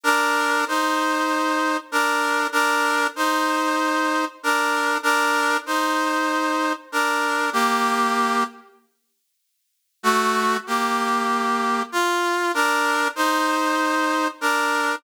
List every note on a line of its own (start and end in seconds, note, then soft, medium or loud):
0.04 0.65 D4 loud
0.04 0.65 A#4 loud
0.68 1.77 D#4 medium
0.68 1.77 C5 medium
1.92 2.47 D4 medium
1.92 2.47 A#4 loud
2.52 3.07 D4 loud
2.52 3.07 A#4 loud
3.16 4.25 D#4 medium
3.16 4.25 C5 medium
4.43 4.98 D4 medium
4.43 4.98 A#4 medium
5.03 5.57 D4 loud
5.03 5.57 A#4 loud
5.66 6.73 D#4 medium
5.66 6.73 C5 medium
6.92 7.50 D4 medium
6.92 7.50 A#4 medium
7.53 8.44 A#3 medium
7.53 8.44 G4 loud
10.03 10.57 A3 loud
10.03 10.57 F#4 loud
10.67 11.83 A#3 medium
10.67 11.83 G4 medium
11.92 12.52 F4 loud
12.54 13.08 D4 loud
12.54 13.08 A#4 loud
13.16 14.28 D#4 medium
13.16 14.28 C5 loud
14.41 14.96 D4 medium
14.41 14.96 A#4 medium